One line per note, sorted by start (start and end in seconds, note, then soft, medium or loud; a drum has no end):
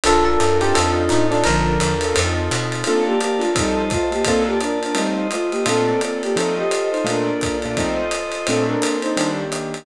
0.03 0.37 A#1 medium
0.03 0.30 D4 loud
0.03 1.24 D4 medium
0.03 0.74 D4 medium
0.03 0.30 F4 medium
0.03 1.24 F4 loud
0.03 0.74 F4 medium
0.03 0.30 A4 medium
0.03 0.74 A4 loud
0.03 0.24 A4 loud
0.03 0.30 A#4 loud
0.03 0.74 A#4 medium
0.03 ride medium
0.25 0.58 A4 medium
0.40 0.73 F#2 medium
0.40 hi-hat pedal medium
0.40 ride medium
0.60 1.01 C4 medium
0.60 1.01 D#4 loud
0.60 1.01 F4 loud
0.60 0.74 G4 medium
0.60 1.01 A4 loud
0.60 ride medium
0.74 1.09 F2 medium
0.74 1.44 C4 medium
0.74 1.44 D#4 loud
0.74 1.44 F4 medium
0.74 1.44 A4 medium
0.74 0.91 A4 medium
0.74 ride medium
1.09 1.44 A2 medium
1.09 1.27 D#4 medium
1.09 hi-hat pedal medium
1.09 ride medium
1.31 1.45 D4 medium
1.31 1.73 D4 loud
1.31 1.73 F4 medium
1.31 1.73 A4 loud
1.31 1.73 A#4 medium
1.31 ride medium
1.44 1.78 A#1 medium
1.44 1.93 D3 medium
1.44 1.93 F3 medium
1.44 2.14 D4 medium
1.44 2.14 F4 medium
1.44 2.14 A4 medium
1.44 2.14 A#4 medium
1.44 2.16 A#4 loud
1.44 ride medium
1.80 2.13 E2 medium
1.80 hi-hat pedal medium
1.80 ride medium
2.01 2.13 D4 medium
2.01 2.13 F4 medium
2.01 2.13 A4 medium
2.01 2.13 A#4 medium
2.01 ride medium
2.14 2.49 F2 medium
2.14 2.41 C4 medium
2.14 2.85 C4 medium
2.14 2.41 D#4 medium
2.14 2.85 D#4 medium
2.14 2.41 F4 medium
2.14 2.85 F4 medium
2.14 2.41 A4 medium
2.14 2.85 A4 medium
2.14 ride medium
2.51 2.83 B2 medium
2.51 hi-hat pedal medium
2.51 ride medium
2.72 ride medium
2.84 3.13 A#3 medium
2.84 3.04 C4 medium
2.84 3.13 D4 medium
2.84 3.13 F4 loud
2.84 3.04 A4 loud
2.84 3.13 A4 loud
2.84 3.55 A#4 medium
2.84 3.55 D5 medium
2.84 3.55 F5 medium
2.84 3.55 A5 medium
2.84 ride medium
3.06 3.19 A#3 medium
3.06 3.19 G4 medium
3.20 3.40 A#3 medium
3.20 3.40 G4 medium
3.20 hi-hat pedal medium
3.20 ride medium
3.39 3.54 A3 medium
3.39 3.49 A#3 medium
3.39 3.49 D4 medium
3.39 3.49 F4 medium
3.39 3.54 F4 medium
3.39 3.49 A4 medium
3.39 ride medium
3.55 3.82 F3 loud
3.55 3.91 G3 medium
3.55 3.82 C4 medium
3.55 3.82 D#4 loud
3.55 3.91 D#4 medium
3.55 4.25 F4 medium
3.55 3.82 A4 loud
3.55 4.25 C5 medium
3.55 4.25 D#5 medium
3.55 4.25 A5 medium
3.55 kick medium
3.55 ride medium
3.90 4.10 A3 medium
3.90 4.10 F4 loud
3.90 kick medium
3.90 hi-hat pedal medium
3.90 ride medium
4.12 4.23 A#3 medium
4.12 4.23 G4 medium
4.12 ride medium
4.24 4.96 A#3 medium
4.24 4.54 A#3 loud
4.24 4.43 C4 medium
4.24 4.54 D4 loud
4.24 4.96 F4 medium
4.24 4.54 F4 loud
4.24 4.43 A4 loud
4.24 4.54 A4 loud
4.24 4.96 D5 medium
4.24 4.96 A5 medium
4.24 kick soft
4.24 ride medium
4.47 4.59 A#3 medium
4.47 4.59 G4 medium
4.60 4.79 D4 medium
4.60 4.79 A#4 loud
4.60 hi-hat pedal medium
4.60 ride medium
4.83 4.97 D4 medium
4.83 4.97 A#4 medium
4.83 ride medium
4.95 5.27 G3 medium
4.95 5.22 A3 medium
4.95 5.66 A3 medium
4.95 5.22 C4 medium
4.95 5.27 D#4 medium
4.95 5.22 D#4 loud
4.95 5.22 F4 loud
4.95 5.66 F4 medium
4.95 5.66 C5 medium
4.95 5.66 D#5 medium
4.95 ride medium
5.31 5.50 A3 medium
5.31 5.50 F4 medium
5.31 hi-hat pedal medium
5.31 ride medium
5.51 5.64 A#3 medium
5.51 5.64 G4 medium
5.51 ride medium
5.66 5.92 A#2 loud
5.66 5.92 A3 loud
5.66 6.37 A#3 medium
5.66 6.00 C4 loud
5.66 5.92 D4 loud
5.66 5.92 F4 loud
5.66 6.36 F4 medium
5.66 6.00 A4 loud
5.66 6.36 A4 medium
5.66 6.37 D5 medium
5.66 ride medium
6.01 6.22 C4 medium
6.01 6.22 A4 medium
6.01 hi-hat pedal medium
6.01 ride medium
6.22 6.36 A#3 medium
6.22 6.36 G4 medium
6.22 ride medium
6.35 6.63 F3 loud
6.35 6.63 A3 loud
6.35 6.54 C4 medium
6.35 6.63 C4 loud
6.35 6.63 D#4 loud
6.35 7.06 F4 medium
6.35 6.54 A4 medium
6.35 7.06 A4 medium
6.35 7.06 C5 medium
6.35 7.06 D#5 medium
6.35 ride medium
6.57 6.89 G4 medium
6.57 6.89 D#5 medium
6.71 hi-hat pedal medium
6.71 ride medium
6.91 7.04 D#4 medium
6.91 7.04 C5 medium
6.91 ride soft
7.04 7.31 A#2 loud
7.04 7.31 A3 loud
7.04 7.76 A#3 medium
7.04 7.31 D4 loud
7.04 7.57 D4 medium
7.04 7.31 F4 loud
7.04 7.76 F4 medium
7.04 7.76 A4 medium
7.04 7.57 A#4 medium
7.04 7.76 D5 medium
7.04 ride medium
7.41 kick soft
7.41 hi-hat pedal medium
7.41 ride medium
7.62 7.75 A#2 medium
7.62 7.75 A3 medium
7.62 7.75 D4 medium
7.62 7.75 F4 medium
7.62 ride medium
7.77 8.04 F3 medium
7.77 8.04 A3 loud
7.77 8.04 C4 loud
7.77 8.04 D#4 loud
7.77 8.47 F4 medium
7.77 8.46 A4 medium
7.77 8.47 C5 medium
7.77 8.47 D#5 medium
7.77 kick soft
7.77 ride medium
8.11 hi-hat pedal medium
8.11 ride medium
8.32 ride medium
8.46 8.74 A#2 loud
8.46 8.74 A3 loud
8.46 9.16 A#3 medium
8.46 8.66 C4 loud
8.46 9.16 C4 medium
8.46 8.74 C4 loud
8.46 9.16 D4 medium
8.46 8.74 D4 loud
8.46 8.66 A4 loud
8.46 9.16 A4 medium
8.46 ride medium
8.66 8.97 D4 medium
8.66 8.97 A#4 loud
8.82 hi-hat pedal medium
8.82 ride medium
9.02 9.31 D#4 medium
9.02 9.31 C5 loud
9.02 ride medium
9.17 9.43 D#3 loud
9.17 9.85 D#3 medium
9.17 9.43 G3 loud
9.17 9.43 A#3 loud
9.17 9.85 A#3 medium
9.17 9.43 D4 loud
9.17 9.85 D4 medium
9.17 9.85 G4 medium
9.17 ride medium
9.52 hi-hat pedal medium
9.52 ride medium
9.74 ride medium